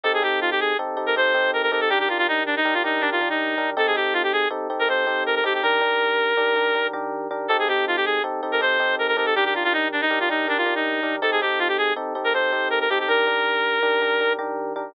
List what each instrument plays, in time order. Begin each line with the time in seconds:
0.03 electric piano 1 C4 D#4 G4 A4, clarinet A4
0.14 clarinet G#4
0.22 electric piano 1 C4 D#4 G4 A4, clarinet G4
0.41 clarinet F4
0.51 clarinet G4
0.60 clarinet G#4
0.79 electric piano 1 C4 D#4 G4 A4
0.97 electric piano 1 C4 D#4 G4 A4
1.06 clarinet A#4
1.16 electric piano 1 C4 D#4 G4 A4, clarinet C5
1.34 electric piano 1 C4 D#4 G4 A4
1.53 clarinet A#4
1.63 clarinet A#4
1.72 electric piano 1 C4 D#4 G4 A4, clarinet A#4
1.81 clarinet A4
1.90 electric piano 1 D#3 D4 G4 A#4, clarinet G4
2.00 clarinet G4
2.08 electric piano 1 D#3 D4 G4 A#4, clarinet F4
2.18 clarinet F4
2.28 clarinet D#4
2.46 clarinet D4
2.56 clarinet D#4
2.65 electric piano 1 D#3 D4 G4 A#4
2.74 clarinet F4
2.84 electric piano 1 D#3 D4 G4 A#4, clarinet D#4
3.01 electric piano 1 D#3 D4 G4 A#4, clarinet D4
3.12 clarinet F4
3.21 electric piano 1 D#3 D4 G4 A#4
3.30 clarinet D#4
3.58 electric piano 1 D#3 D4 G4 A#4
3.77 electric piano 1 C4 D#4 G4 A4, clarinet A4
3.87 clarinet G#4
3.95 electric piano 1 C4 D#4 G4 A4, clarinet G4
4.14 clarinet F4
4.23 clarinet G4
4.33 clarinet G#4
4.50 electric piano 1 C4 D#4 G4 A4
4.70 electric piano 1 C4 D#4 G4 A4
4.79 clarinet A#4
4.88 electric piano 1 C4 D#4 G4 A4, clarinet C5
5.07 electric piano 1 C4 D#4 G4 A4
5.26 clarinet A#4
5.35 clarinet A#4
5.44 electric piano 1 C4 D#4 G4 A4, clarinet G4
5.54 clarinet G4
5.63 electric piano 1 D#3 D4 G4 A#4, clarinet A#4
5.81 electric piano 1 D#3 D4 G4 A#4
6.37 electric piano 1 D#3 D4 G4 A#4
6.56 electric piano 1 D#3 D4 G4 A#4
6.75 electric piano 1 D#3 D4 G4 A#4
6.93 electric piano 1 D#3 D4 G4 A#4
7.31 electric piano 1 D#3 D4 G4 A#4
7.48 electric piano 1 C4 D#4 G4 A4, clarinet A4
7.59 clarinet G#4
7.68 electric piano 1 C4 D#4 G4 A4, clarinet G4
7.87 clarinet F4
7.96 clarinet G4
8.05 clarinet G#4
8.24 electric piano 1 C4 D#4 G4 A4
8.43 electric piano 1 C4 D#4 G4 A4
8.52 clarinet A#4
8.60 electric piano 1 C4 D#4 G4 A4, clarinet C5
8.80 electric piano 1 C4 D#4 G4 A4
8.99 clarinet A#4
9.08 clarinet A#4
9.17 electric piano 1 C4 D#4 G4 A4, clarinet A#4
9.26 clarinet A4
9.35 electric piano 1 D#3 D4 G4 A#4, clarinet G4
9.45 clarinet G4
9.54 electric piano 1 D#3 D4 G4 A#4, clarinet F4
9.64 clarinet F4
9.73 clarinet D#4
9.92 clarinet D4
10.01 clarinet D#4
10.10 electric piano 1 D#3 D4 G4 A#4
10.20 clarinet F4
10.29 electric piano 1 D#3 D4 G4 A#4, clarinet D#4
10.48 electric piano 1 D#3 D4 G4 A#4, clarinet D4
10.58 clarinet F4
10.66 electric piano 1 D#3 D4 G4 A#4
10.75 clarinet D#4
11.03 electric piano 1 D#3 D4 G4 A#4
11.22 electric piano 1 C4 D#4 G4 A4, clarinet A4
11.32 clarinet G#4
11.41 electric piano 1 C4 D#4 G4 A4, clarinet G4
11.59 clarinet F4
11.68 clarinet G4
11.78 clarinet G#4
11.96 electric piano 1 C4 D#4 G4 A4
12.15 electric piano 1 C4 D#4 G4 A4
12.24 clarinet A#4
12.34 electric piano 1 C4 D#4 G4 A4, clarinet C5
12.52 electric piano 1 C4 D#4 G4 A4
12.70 clarinet A#4
12.81 clarinet A#4
12.90 electric piano 1 C4 D#4 G4 A4, clarinet G4
13.00 clarinet G4
13.08 electric piano 1 D#3 D4 G4 A#4, clarinet A#4
13.27 electric piano 1 D#3 D4 G4 A#4
13.83 electric piano 1 D#3 D4 G4 A#4
14.02 electric piano 1 D#3 D4 G4 A#4
14.20 electric piano 1 D#3 D4 G4 A#4
14.39 electric piano 1 D#3 D4 G4 A#4
14.76 electric piano 1 D#3 D4 G4 A#4